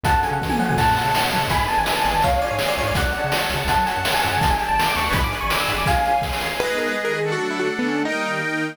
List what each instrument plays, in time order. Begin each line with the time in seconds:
0.03 synth bass 1 F#2, accordion C#4 F#4 A4, string ensemble 1 C#4 F#4 A4, electric piano 1 F#5 A5, kick, closed hi-hat
0.11 synth bass 1 F#2
0.16 synth bass 1 F#2
0.23 accordion C#4 F#4 A4, electric piano 1 G#5, closed hi-hat
0.31 synth bass 1 C#3, electric piano 1 F#5
0.41 synth bass 1 E3, kick, snare
0.50 electric piano 1 G#5, high tom
0.59 synth bass 1 F3, accordion C#4 F#4 A4, electric piano 1 F#5, mid tom
0.69 electric piano 1 G#5, floor tom
0.76 synth bass 1 F#2, accordion C#4 F#4 A4, string ensemble 1 C#5 F#5 A5, electric piano 1 F#5 A5, kick, crash
0.83 synth bass 1 F#2
0.89 synth bass 1 F#2
0.97 accordion C#4 F#4 A4, closed hi-hat
1.04 synth bass 1 C#3
1.15 snare
1.31 synth bass 1 F#3, accordion C#4 F#4 A4, closed hi-hat
1.37 synth bass 1 C#3
1.47 synth bass 1 G#1 F#2, accordion B3, string ensemble 1 B4 D5 G#5, electric piano 1 G#5 B5, kick, closed hi-hat
1.52 synth bass 1 G#1, accordion D4 G#4
1.58 synth bass 1 G#2
1.68 accordion B3 D4 G#4, electric piano 1 A5, closed hi-hat
1.77 synth bass 1 G#1, electric piano 1 G#5
1.86 snare
1.97 electric piano 1 A5
2.05 synth bass 1 G#1, accordion B3 D4 G#4, electric piano 1 G#5, closed hi-hat
2.09 synth bass 1 G#1
2.15 synth bass 1 G#1, electric piano 1 A5
2.22 synth bass 1 C#2, accordion C#4 F4 G#4, string ensemble 1 C#5 F5 G#5, electric piano 1 C#5 F5, kick, closed hi-hat
2.28 synth bass 1 C#3
2.32 synth bass 1 C#2
2.42 accordion C#4 F4 G#4, electric piano 1 D5, closed hi-hat
2.51 synth bass 1 G#2, electric piano 1 C#5
2.59 snare
2.68 electric piano 1 D5
2.77 synth bass 1 C#2, accordion C#4 F4 G#4, electric piano 1 C#5, closed hi-hat
2.83 synth bass 1 G#2
2.87 synth bass 1 C#2, electric piano 1 D5
2.95 synth bass 1 C#2, accordion C#4 F#4 A4, string ensemble 1 C#5 F#5 A5, electric piano 1 D5 F#5, kick, closed hi-hat
3.02 synth bass 1 C#2
3.13 accordion C#4 F#4 A4, closed hi-hat
3.24 synth bass 1 C#3
3.32 snare
3.49 synth bass 1 C#2, accordion C#4 F#4 A4, closed hi-hat
3.54 synth bass 1 C#3
3.65 synth bass 1 C#2 F#2, accordion C#4, closed hi-hat
3.69 accordion F#4 A4, string ensemble 1 C#5 F#5 A5, electric piano 1 F#5 A5, kick
3.74 synth bass 1 F#2 F#3
3.86 accordion C#4 F#4 A4, electric piano 1 G#5, closed hi-hat
3.96 synth bass 1 F#2, electric piano 1 F#5
4.05 snare
4.14 electric piano 1 G#5
4.22 synth bass 1 F#2, accordion C#4 F#4 A4, electric piano 1 F#5, closed hi-hat
4.29 synth bass 1 F#2, electric piano 1 G#5
4.37 synth bass 1 C#3
4.41 synth bass 1 G1, accordion D4 G4 A4, string ensemble 1 D5 G5 A5, electric piano 1 A5, kick, closed hi-hat
4.46 synth bass 1 G1
4.50 synth bass 1 G1, electric piano 1 G#5
4.59 accordion D4 G4 A4, closed hi-hat
4.68 synth bass 1 G1, electric piano 1 A5
4.78 electric piano 1 A5, snare
4.87 electric piano 1 D6
4.96 synth bass 1 D2, accordion D4 G4 A4, electric piano 1 C#6, closed hi-hat
5.00 synth bass 1 D2
5.05 accordion D4 G#4 B4
5.11 synth bass 1 G1 G#1, string ensemble 1 D5 G#5 B5, electric piano 1 B5, kick, closed hi-hat
5.20 synth bass 1 G#1
5.24 synth bass 1 G#2, electric piano 1 D6
5.31 accordion D4 G#4 B4, closed hi-hat
5.41 synth bass 1 G#1, electric piano 1 C#6
5.50 electric piano 1 D6, snare
5.60 electric piano 1 E6
5.68 synth bass 1 G#2, accordion D4 G#4 B4, closed hi-hat
5.73 synth bass 1 G#1
5.78 electric piano 1 D6
5.83 synth bass 1 G#1, kick
5.87 accordion C#4 F4 G#4, string ensemble 1 C#5 F5 G#5, electric piano 1 F5 G#5, closed hi-hat
6.05 accordion C#4 F4 G#4, closed hi-hat
6.22 kick, snare
6.33 snare
6.41 accordion C#4 F4 G#4, snare
6.59 string ensemble 1 G#3 B3 D#4, accordion G#4 B4 D#5, acoustic grand piano B4
6.78 acoustic grand piano A#4
6.87 acoustic grand piano B4
6.97 string ensemble 1 D#3 G#3 D#4
7.05 acoustic grand piano A#4
7.14 acoustic grand piano G#4
7.22 accordion D4 A4 F#5
7.32 string ensemble 1 D3 F#3 A3, acoustic grand piano F#4
7.51 acoustic grand piano E4
7.60 acoustic grand piano F#4
7.69 string ensemble 1 D3 A3 D4
7.79 acoustic grand piano B3
7.88 acoustic grand piano C#4
8.04 string ensemble 1 D#3 G3 A#3, accordion D#4 A#4 G5, acoustic grand piano D#4
8.41 string ensemble 1 D#3 A#3 D#4